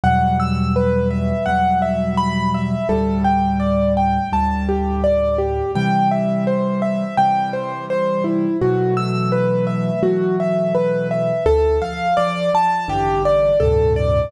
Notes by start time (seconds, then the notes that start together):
0.04 E2 B2 F#3 G3 F#5
0.40 E6
0.76 B4
1.11 E5
1.46 E2 B2 F#3 G3 F#5
1.82 E5
2.18 B5
2.54 E5
2.89 D2 A2 G3 A4
3.24 G5
3.60 D5
3.97 G5
4.32 D2 A2 G3 A5
4.69 G4
5.04 D5
5.38 G4
5.75 C3 E3 G3 G5
6.11 E5
6.47 C5
6.82 E5
7.17 C3 E3 G3 G5
7.53 C5
7.90 C5
8.24 E4
8.61 B2 E3 F#3 A3 F#4
8.97 E6
9.32 B4
9.67 E5
10.03 B2 E3 F#3 A3 F#4
10.40 E5
10.75 B4
11.11 E5
11.46 D2 A4
11.82 F3 F5
12.17 F3 D5
12.54 F3 A5
12.88 A1 G2 D3 E3 G4
13.25 D5
13.60 D2 G2 A2 C3 A4
13.96 D5